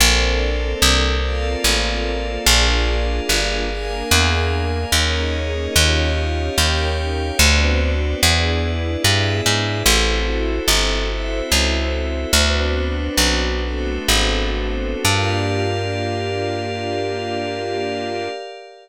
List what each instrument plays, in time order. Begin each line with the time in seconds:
0.00 electric bass (finger) A#1, string ensemble 1 A#3 C4 D4 A4, pad 5 (bowed) A4 A#4 C5 D5
0.82 electric bass (finger) C2
1.23 string ensemble 1 A#3 C4 F4 A4, pad 5 (bowed) A4 A#4 D5 F5
1.64 electric bass (finger) A1
2.46 electric bass (finger) A#1, string ensemble 1 A#3 D4 F4 G#4, pad 5 (bowed) G#4 A#4 D5 F5
3.29 electric bass (finger) G1
3.70 string ensemble 1 A#3 D4 G#4 A#4, pad 5 (bowed) G#4 A#4 F5 G#5
4.11 electric bass (finger) E2
4.92 electric bass (finger) D#2, string ensemble 1 A#3 C#4 D#4 G#4, pad 5 (bowed) G#4 A#4 C#5 D#5
5.75 electric bass (finger) D#2, string ensemble 1 C#4 D#4 F4 G4, pad 5 (bowed) G4 C#5 D#5 F5
6.57 electric bass (finger) D#2, string ensemble 1 C#4 D#4 G4 A#4, pad 5 (bowed) G4 C#5 F5 G5
7.39 electric bass (finger) D2, string ensemble 1 B3 C4 D4 F#4, pad 5 (bowed) F#4 B4 C5 D5
8.22 electric bass (finger) E2, string ensemble 1 B3 D4 E4 G#4, pad 5 (bowed) E4 G#4 B4 D5
9.02 electric bass (finger) G2, string ensemble 1 B3 D4 G#4 B4, pad 5 (bowed) E4 G#4 D5 E5
9.46 electric bass (finger) G#2
9.86 electric bass (finger) A1, string ensemble 1 C4 E4 F#4 A4, pad 5 (bowed) E4 F#4 A4 C5
10.68 electric bass (finger) G1
11.10 string ensemble 1 C4 E4 A4 C5, pad 5 (bowed) E4 F#4 C5 E5
11.52 electric bass (finger) C#2
12.33 electric bass (finger) D2, string ensemble 1 B3 C4 D4 F#4, pad 5 (bowed) D4 F#4 B4 C5
13.17 electric bass (finger) B1
13.62 string ensemble 1 A3 B3 C4 F#4, pad 5 (bowed) D4 F#4 A4 C5
14.08 electric bass (finger) G#1
15.04 electric bass (finger) G2, string ensemble 1 A#3 D4 F4 G4, pad 5 (bowed) G4 A#4 D5 F5